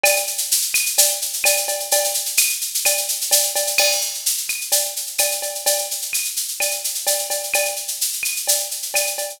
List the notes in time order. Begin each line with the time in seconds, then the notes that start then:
0.04 cowbell, claves, shaker
0.16 shaker
0.27 shaker
0.38 shaker
0.51 shaker
0.62 shaker
0.74 claves, shaker
0.86 shaker
0.98 cowbell, shaker
1.09 shaker
1.22 shaker
1.33 shaker
1.44 cowbell, claves, shaker
1.57 shaker
1.68 cowbell, shaker
1.80 shaker
1.91 cowbell, shaker
2.04 shaker
2.14 shaker
2.26 shaker
2.37 claves, shaker
2.49 shaker
2.61 shaker
2.74 shaker
2.85 cowbell, claves, shaker
2.97 shaker
3.08 shaker
3.21 shaker
3.31 cowbell, shaker
3.43 shaker
3.56 cowbell, shaker
3.67 shaker
3.78 crash, cowbell, claves
3.92 shaker
4.01 shaker
4.14 shaker
4.26 shaker
4.37 shaker
4.49 claves, shaker
4.61 shaker
4.72 cowbell, shaker
4.85 shaker
4.96 shaker
5.07 shaker
5.18 cowbell, claves, shaker
5.31 shaker
5.42 cowbell, shaker
5.55 shaker
5.66 cowbell, shaker
5.78 shaker
5.91 shaker
6.02 shaker
6.13 claves, shaker
6.25 shaker
6.36 shaker
6.48 shaker
6.60 cowbell, claves, shaker
6.71 shaker
6.84 shaker
6.95 shaker
7.07 cowbell, shaker
7.19 shaker
7.30 cowbell, shaker
7.43 shaker
7.54 cowbell, claves, shaker
7.65 shaker
7.76 shaker
7.88 shaker
8.01 shaker
8.13 shaker
8.23 claves, shaker
8.36 shaker
8.47 cowbell, shaker
8.59 shaker
8.71 shaker
8.82 shaker
8.94 cowbell, claves, shaker
9.07 shaker
9.18 cowbell, shaker
9.30 shaker